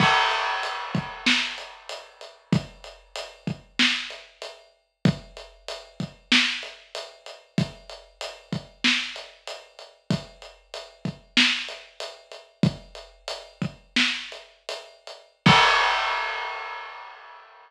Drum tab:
CC |x-------|--------|--------|--------|
HH |-xxx-xxx|xxxx-xx-|xxxx-xxx|xxxx-xxx|
SD |----o---|----o---|----o---|----o---|
BD |o--o----|o--o----|o--o----|o--o----|

CC |--------|--------|x-------|
HH |xxxx-xxx|xxxx-xxx|--------|
SD |----o---|----o---|--------|
BD |o--o----|o--o----|o-------|